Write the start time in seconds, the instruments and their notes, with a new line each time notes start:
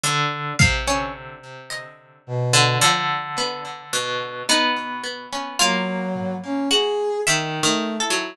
0.03 orchestral harp D3, closed hi-hat
0.59 orchestral harp C3, pizzicato strings F5, kick
0.87 pizzicato strings C#4
1.70 pizzicato strings D#5, closed hi-hat
2.27 brass section B2
2.53 orchestral harp D3
2.81 orchestral harp D3, pizzicato strings F3, cowbell
3.38 pizzicato strings B3
3.93 orchestral harp B2
4.49 orchestral harp B3, pizzicato strings D#4
5.03 pizzicato strings B3
5.32 pizzicato strings C#4
5.59 brass section F#3, orchestral harp A#3, pizzicato strings F4
6.15 floor tom
6.44 brass section C#4
6.70 pizzicato strings F#4, brass section G#4
7.27 brass section D#3, orchestral harp D#3, pizzicato strings E5
7.63 pizzicato strings D#3, brass section A3
8.00 brass section E4, pizzicato strings A4
8.10 orchestral harp F#3